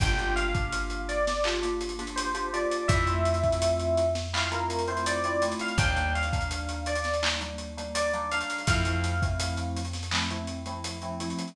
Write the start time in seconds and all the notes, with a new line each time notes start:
0.00 G1 A#3 D4 F4 G4 G5, kick, closed hi-hat
0.18 A#3 D4 F4 G4, closed hi-hat
0.36 F5, closed hi-hat
0.54 A#3 D4 F4 G4, kick, closed hi-hat
0.72 closed hi-hat
0.90 closed hi-hat
1.09 D5, closed hi-hat
1.27 snare, closed hi-hat
1.44 A#3 D4 F4 G4, clap
1.62 A#3 D4 F4 G4, closed hi-hat
1.81 closed hi-hat
1.89 closed hi-hat
1.99 A#3 D4 F4 G4, closed hi-hat
2.07 closed hi-hat
2.16 C5, closed hi-hat
2.34 A#3 D4 F4 G4, closed hi-hat
2.53 A#3 D4 F4 G4 D5, closed hi-hat
2.71 closed hi-hat
2.88 F2 A3 C4 E4 F4 E5, kick, closed hi-hat
3.07 A3 C4 E4 F4, closed hi-hat
3.25 closed hi-hat
3.34 closed hi-hat
3.43 A3 C4 E4 F4, kick, closed hi-hat
3.52 closed hi-hat
3.62 closed hi-hat
3.79 closed hi-hat
3.97 closed hi-hat
4.15 snare, closed hi-hat
4.33 A3 C4 E4 F4 F5, clap
4.52 A3 C4 E4 F4 A#4, closed hi-hat
4.70 closed hi-hat
4.79 closed hi-hat
4.88 A3 C4 E4 F4 C5, closed hi-hat
4.97 closed hi-hat
5.06 D5, closed hi-hat
5.24 A3 C4 E4 F4 D5, closed hi-hat
5.42 A3 C4 E4 F4, closed hi-hat
5.52 closed hi-hat
5.59 F5, closed hi-hat
5.68 closed hi-hat
5.78 D#2 G3 A#3 D4 D#4 G5, kick, closed hi-hat
5.96 G3 A#3 D4 D#4, closed hi-hat
6.15 F5, closed hi-hat
6.23 closed hi-hat
6.33 G3 A#3 D4 D#4, kick, closed hi-hat
6.41 closed hi-hat
6.51 closed hi-hat
6.69 closed hi-hat
6.86 D5, closed hi-hat
6.95 closed hi-hat
7.04 snare, closed hi-hat
7.14 closed hi-hat
7.23 G3 A#3 D4 D#4, clap
7.41 G3 A#3 D4 D#4, closed hi-hat
7.58 closed hi-hat
7.77 G3 A#3 D4 D#4, closed hi-hat
7.95 D5, closed hi-hat
8.13 G3 A#3 D4 D#4, closed hi-hat
8.31 G3 A#3 D4 D#4 F5, closed hi-hat
8.41 closed hi-hat
8.50 closed hi-hat
8.58 closed hi-hat
8.67 F2 F3 A3 C4 E4 F5, kick, closed hi-hat
8.85 F3 A3 C4 E4, closed hi-hat
9.04 closed hi-hat
9.22 F3 A3 C4 E4, kick, closed hi-hat
9.40 closed hi-hat
9.57 closed hi-hat
9.77 closed hi-hat
9.85 closed hi-hat
9.93 snare, closed hi-hat
10.03 closed hi-hat
10.11 F3 A3 C4 E4, clap
10.30 F3 A3 C4 E4, closed hi-hat
10.47 closed hi-hat
10.66 F3 A3 C4 E4, closed hi-hat
10.84 closed hi-hat
11.02 F3 A3 C4 E4, closed hi-hat
11.20 F3 A3 C4 E4, closed hi-hat
11.30 closed hi-hat
11.39 closed hi-hat
11.47 closed hi-hat